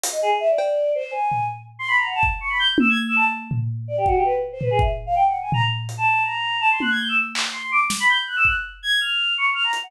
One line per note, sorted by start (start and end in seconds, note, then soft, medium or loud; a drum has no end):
0.04 closed hi-hat loud
0.12 0.20 D#5 medium
0.22 0.30 G#4 medium
0.40 0.48 E5 loud
0.49 0.90 D5 medium
0.58 cowbell loud
0.95 1.11 C5 medium
1.11 1.44 G#5 medium
1.32 floor tom soft
1.79 1.87 C6 loud
1.88 1.96 B5 medium
1.97 2.05 A#5 medium
2.06 2.14 F#5 medium
2.15 2.23 A5 medium
2.23 kick medium
2.40 2.49 C#6 medium
2.50 2.58 B5 medium
2.59 2.67 G6 loud
2.78 2.88 E6 loud
2.78 high tom loud
2.89 2.98 G#6 medium
3.07 3.15 E6 medium
3.16 3.24 A5 loud
3.51 floor tom medium
3.88 3.96 D5 medium
3.97 4.06 G4 medium
4.06 4.15 F#4 loud
4.06 kick medium
4.15 4.24 G4 medium
4.25 4.33 B4 medium
4.52 4.61 C5 medium
4.61 4.70 B4 medium
4.61 floor tom medium
4.71 4.79 G#4 medium
4.79 4.88 E5 medium
4.79 kick medium
5.06 5.14 F5 medium
5.15 5.23 G5 loud
5.27 5.35 F#5 medium
5.41 5.50 G#5 medium
5.52 5.62 A#5 loud
5.52 floor tom loud
5.89 closed hi-hat medium
5.98 6.22 A5 medium
6.24 6.57 A#5 medium
6.61 6.69 A5 loud
6.71 6.80 C6 medium
6.80 6.90 F#6 medium
6.80 high tom medium
6.90 6.99 G#6 medium
6.99 7.08 G6 medium
7.09 7.17 E6 medium
7.35 clap loud
7.52 7.69 C6 medium
7.72 7.80 D6 loud
7.90 snare medium
8.00 8.08 B5 loud
8.09 8.17 G6 loud
8.27 8.36 F#6 medium
8.36 8.45 E6 loud
8.45 8.54 F#6 medium
8.45 kick medium
8.83 8.99 G#6 medium
9.00 9.33 F6 medium
9.38 9.46 C#6 medium
9.54 9.63 F6 loud
9.63 9.72 A#5 medium
9.73 closed hi-hat medium
9.83 9.91 F#5 loud